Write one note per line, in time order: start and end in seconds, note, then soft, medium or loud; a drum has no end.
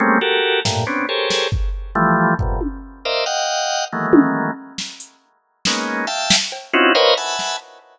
0.00 0.19 G3 loud
0.00 0.19 G#3 loud
0.00 0.19 A3 loud
0.00 0.19 A#3 loud
0.00 0.19 C4 loud
0.00 0.19 C#4 loud
0.21 0.60 F#4 medium
0.21 0.60 G4 medium
0.21 0.60 A4 medium
0.21 0.60 A#4 medium
0.65 0.85 G2 medium
0.65 0.85 A2 medium
0.65 0.85 A#2 medium
0.65 snare medium
0.87 1.06 B3 medium
0.87 1.06 C4 medium
0.87 1.06 C#4 medium
0.87 1.06 D4 medium
1.09 1.48 G4 medium
1.09 1.48 G#4 medium
1.09 1.48 A4 medium
1.09 1.48 A#4 medium
1.09 1.48 C5 medium
1.09 1.48 C#5 medium
1.30 snare medium
1.52 kick medium
1.95 2.34 E3 loud
1.95 2.34 F3 loud
1.95 2.34 G3 loud
1.95 2.34 A3 loud
2.39 2.60 F2 medium
2.39 2.60 G2 medium
2.39 2.60 A2 medium
2.39 2.60 A#2 medium
2.39 2.60 B2 medium
2.39 kick medium
2.61 high tom medium
3.05 3.25 A#4 medium
3.05 3.25 C5 medium
3.05 3.25 D5 medium
3.05 3.25 D#5 medium
3.05 3.25 E5 medium
3.05 3.25 F5 medium
3.26 3.85 D#5 medium
3.26 3.85 F5 medium
3.26 3.85 F#5 medium
3.26 3.85 G5 medium
3.92 4.51 D#3 medium
3.92 4.51 E3 medium
3.92 4.51 F#3 medium
3.92 4.51 G#3 medium
3.92 4.51 A3 medium
3.92 4.51 A#3 medium
4.13 high tom loud
4.78 snare medium
5.00 closed hi-hat medium
5.65 6.06 G#3 medium
5.65 6.06 A#3 medium
5.65 6.06 B3 medium
5.65 6.06 C#4 medium
5.65 6.06 D#4 medium
5.65 snare medium
6.07 6.36 E5 medium
6.07 6.36 F5 medium
6.07 6.36 G5 medium
6.07 6.36 A5 medium
6.30 snare loud
6.52 cowbell medium
6.73 6.93 C4 loud
6.73 6.93 C#4 loud
6.73 6.93 D#4 loud
6.73 6.93 E4 loud
6.73 6.93 F4 loud
6.73 6.93 F#4 loud
6.95 7.14 A#4 loud
6.95 7.14 B4 loud
6.95 7.14 C5 loud
6.95 7.14 C#5 loud
6.95 7.14 D#5 loud
6.95 7.14 F5 loud
6.95 cowbell medium
7.17 7.56 E5 medium
7.17 7.56 F#5 medium
7.17 7.56 G#5 medium
7.17 7.56 A5 medium
7.17 7.56 B5 medium
7.39 snare medium